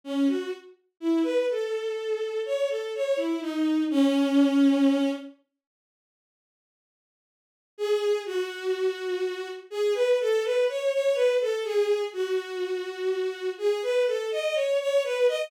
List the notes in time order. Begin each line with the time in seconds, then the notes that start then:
0.04 C#4
0.27 F#4
1.00 E4
1.23 B4
1.50 A4
2.45 C#5
2.69 A4
2.95 C#5
3.16 E4
3.41 D#4
3.90 C#4
7.78 G#4
8.26 F#4
9.70 G#4
9.94 B4
10.20 A4
10.44 B4
10.69 C#5
10.93 C#5
11.14 B4
11.41 A4
11.64 G#4
12.13 F#4
13.58 G#4
13.82 B4
14.07 A4
14.31 D#5
14.54 C#5
14.80 C#5
15.04 B4
15.28 D#5